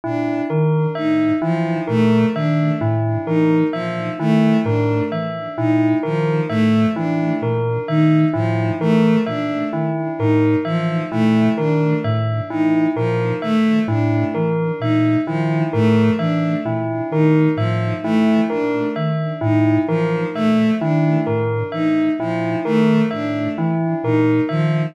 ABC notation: X:1
M:6/8
L:1/8
Q:3/8=43
K:none
V:1 name="Ocarina" clef=bass
_B,, _E, A,, =E, B,, _E, | A,, E, _B,, _E, A,, =E, | _B,, _E, A,, =E, B,, _E, | A,, E, _B,, _E, A,, =E, |
_B,, _E, A,, =E, B,, _E, | A,, E, _B,, _E, A,, =E, | _B,, _E, A,, =E, B,, _E, | A,, E, _B,, _E, A,, =E, |
_B,, _E, A,, =E, B,, _E, |]
V:2 name="Violin"
D z _E F, A, D | z _E F, A, D z | _E F, A, D z E | F, A, D z _E F, |
A, D z _E F, A, | D z _E F, A, D | z _E F, A, D z | _E F, A, D z E |
F, A, D z _E F, |]
V:3 name="Tubular Bells"
E _B e E B e | E _B e E B e | E _B e E B e | E _B e E B e |
E _B e E B e | E _B e E B e | E _B e E B e | E _B e E B e |
E _B e E B e |]